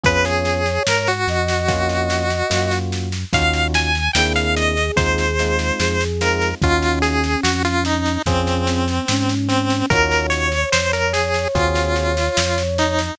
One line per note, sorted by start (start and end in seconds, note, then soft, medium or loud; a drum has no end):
0.04 0.79 F2 loud
0.04 0.61 B3 loud
0.04 0.61 C#4 loud
0.04 0.61 F4 loud
0.04 0.61 G#4 loud
0.04 0.25 B4 medium
0.04 1.11 C#5 medium
0.04 kick loud
0.04 snare medium
0.25 0.83 G#4 medium
0.25 snare medium
0.45 snare medium
0.66 snare medium
0.87 1.26 G#2 medium
0.87 1.08 A#4 medium
0.87 snare loud
1.07 2.79 F#4 medium
1.07 snare medium
1.28 2.43 F2 loud
1.28 2.71 D#5 medium
1.28 snare medium
1.48 snare medium
1.68 2.26 A#3 loud
1.68 2.26 C#4 loud
1.68 2.26 F4 loud
1.68 2.26 F#4 loud
1.68 kick medium
1.68 snare medium
1.89 snare medium
2.10 snare medium
2.30 snare medium
2.50 3.25 F#2 loud
2.50 3.08 A#3 medium
2.50 3.08 C#4 medium
2.50 3.08 F4 medium
2.50 3.08 F#4 medium
2.50 snare loud
2.72 snare medium
2.92 snare medium
3.12 snare medium
3.33 4.09 D#2 loud
3.33 3.90 C#4 loud
3.33 3.90 D#4 loud
3.33 3.90 F4 loud
3.33 3.90 F#4 loud
3.33 3.68 F5 medium
3.33 kick loud
3.33 snare loud
3.54 snare medium
3.74 4.12 G#5 medium
3.74 snare loud
3.95 snare medium
4.13 4.91 D#2 loud
4.13 4.73 A#3 loud
4.13 4.73 C4 loud
4.13 4.73 D4 loud
4.13 4.73 E4 loud
4.13 5.57 G#4 medium
4.13 4.33 G5 medium
4.13 snare loud
4.36 4.55 F5 medium
4.36 snare medium
4.57 4.92 D#5 medium
4.57 snare medium
4.77 snare medium
4.96 5.71 D#2 loud
4.96 5.25 G#3 loud
4.96 5.25 C4 loud
4.96 5.25 D#4 loud
4.96 5.25 F4 loud
4.96 6.04 C5 medium
4.96 kick loud
4.96 snare loud
5.18 snare medium
5.39 5.97 G#3 loud
5.39 5.97 C4 loud
5.39 5.97 D#4 loud
5.39 5.97 F4 loud
5.39 snare medium
5.59 snare medium
5.79 6.54 F2 loud
5.79 6.49 G#4 medium
5.79 snare loud
6.01 snare medium
6.21 6.50 G#3 loud
6.21 6.50 C4 loud
6.21 6.50 D#4 medium
6.21 6.50 F4 loud
6.21 6.55 A#4 medium
6.21 snare medium
6.42 snare medium
6.61 7.36 D#2 loud
6.61 8.18 C#4 medium
6.61 7.21 C#4 loud
6.61 7.21 D#4 loud
6.61 7.21 F4 loud
6.61 6.99 F4 medium
6.61 7.21 F#4 loud
6.61 kick loud
6.61 snare medium
6.83 snare medium
7.02 7.41 G#4 medium
7.02 snare medium
7.24 snare medium
7.43 8.18 F2 loud
7.43 7.63 F#4 medium
7.43 snare loud
7.65 7.84 F4 medium
7.65 snare medium
7.85 8.22 D#4 medium
7.85 snare medium
8.06 snare medium
8.26 9.00 F2 loud
8.26 8.65 C4 medium
8.26 8.84 C4 loud
8.26 9.35 C4 medium
8.26 8.84 C#4 loud
8.26 8.84 F4 loud
8.26 8.84 G#4 loud
8.26 kick loud
8.26 snare medium
8.47 snare medium
8.66 9.05 C4 medium
8.66 snare medium
8.88 snare medium
9.08 9.83 G#2 loud
9.08 9.87 C#4 medium
9.08 snare loud
9.29 snare medium
9.48 9.86 C4 medium
9.48 snare medium
9.70 snare medium
9.90 10.65 D#2 loud
9.90 10.48 C#4 loud
9.90 10.48 D#4 loud
9.90 10.48 F4 loud
9.90 10.48 F#4 loud
9.90 10.27 A#4 loud
9.90 13.00 C#5 medium
9.90 kick loud
9.90 snare medium
10.11 snare medium
10.30 10.70 C#5 medium
10.30 snare medium
10.52 snare medium
10.72 11.47 F2 medium
10.72 10.92 C5 medium
10.72 snare loud
10.93 11.13 A#4 medium
10.93 snare medium
11.13 11.48 G#4 medium
11.13 snare loud
11.34 snare medium
11.55 12.29 D#2 loud
11.55 12.13 C4 loud
11.55 12.13 F4 loud
11.55 12.63 F4 medium
11.55 12.13 F#4 loud
11.55 12.13 G#4 loud
11.55 kick loud
11.55 snare medium
11.76 snare medium
11.96 snare medium
12.17 snare medium
12.37 13.11 F2 medium
12.37 snare loud
12.58 snare medium
12.78 13.15 D#4 medium
12.78 snare medium
12.99 snare medium